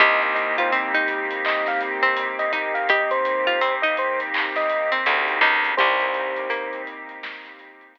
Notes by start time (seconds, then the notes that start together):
0.00 C2 A#3 C4 D#4 G4 D#5, kick, closed hi-hat
0.22 D#5, closed hi-hat
0.35 D#5, closed hi-hat
0.58 F4 C5, kick, closed hi-hat
0.72 C4, closed hi-hat
0.94 D#4, closed hi-hat
1.08 closed hi-hat
1.31 closed hi-hat
1.45 D#5, clap
1.66 F5, snare, closed hi-hat
1.81 closed hi-hat
2.03 C4, closed hi-hat
2.17 closed hi-hat
2.39 D#5, closed hi-hat
2.53 D#4, kick, closed hi-hat
2.74 F5, closed hi-hat
2.89 G4 D#5, kick, closed hi-hat
3.11 C5, closed hi-hat
3.25 closed hi-hat
3.47 F4, closed hi-hat
3.61 C4, closed hi-hat
3.82 D#4 D#5, closed hi-hat
3.97 C5, closed hi-hat
4.20 closed hi-hat
4.34 clap
4.56 D#5, snare, closed hi-hat
4.70 closed hi-hat
4.92 C4, closed hi-hat
5.06 D2, closed hi-hat
5.28 closed hi-hat
5.41 C#2 D#4, kick
5.64 closed hi-hat
5.77 C2 A#3 C4 D#4 G4 C5, kick, closed hi-hat
6.00 closed hi-hat
6.14 closed hi-hat
6.36 closed hi-hat
6.50 A#3, closed hi-hat
6.73 closed hi-hat
6.87 closed hi-hat
7.09 closed hi-hat
7.23 snare
7.45 snare, closed hi-hat
7.59 closed hi-hat
7.81 closed hi-hat
7.95 closed hi-hat